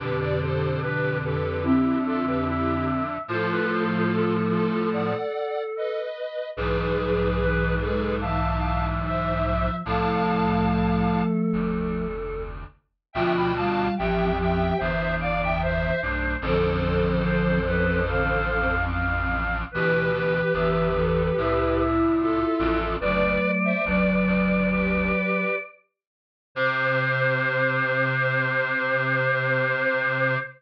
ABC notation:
X:1
M:4/4
L:1/16
Q:1/4=73
K:C
V:1 name="Lead 1 (square)"
[GB] [Bd] [Ac]2 [GB]2 [GB]2 [EG]2 [FA] [GB] [EG]2 z2 | [FA]6 [FA]2 [d^f]4 [B^d]4 | [^GB]6 [GB]2 [fa]4 [ce]4 | [fa]8 z8 |
[eg] [gb] [fa]2 [eg]2 [eg]2 [ce]2 [df] [eg] [ce]2 z2 | [Ac]14 z2 | [GB]12 [FA]4 | "^rit." [Bd]3 [ce] [Bd]4 [GB]4 z4 |
c16 |]
V:2 name="Choir Aahs"
G2 G2 B2 A2 e2 e2 e4 | c B c2 A10 z2 | ^G2 G2 B2 A2 e2 e2 e4 | A4 A10 z2 |
F2 F2 G2 G2 c2 d2 c4 | A2 A2 c2 B2 f2 f2 f4 | B2 B2 e2 A2 e2 e2 e4 | "^rit." d14 z2 |
c16 |]
V:3 name="Flute"
[B,,D,]8 C8 | [F,A,]10 z6 | E,2 F,2 E,2 ^G,2 E,6 F,2 | [F,A,]12 z4 |
F,2 G,2 F,2 F,2 E,6 A,2 | [D,F,]6 F,2 D,2 z6 | E,2 E,2 E,2 E,2 E8 | "^rit." [^F,A,]4 F,8 z4 |
C,16 |]
V:4 name="Clarinet" clef=bass
[F,,D,]16 | [A,,F,]10 z6 | [B,,,^G,,]16 | [C,,A,,]8 [F,,,D,,]6 z2 |
[D,,B,,]4 [A,,,F,,]4 [G,,,E,,]6 [B,,,G,,]2 | [A,,,F,,]16 | [D,,B,,]4 [G,,,E,,]4 [C,,A,,]6 [A,,,F,,]2 | "^rit." [^F,,,D,,]2 z2 [F,,,D,,]2 [F,,,D,,]4 z6 |
C,16 |]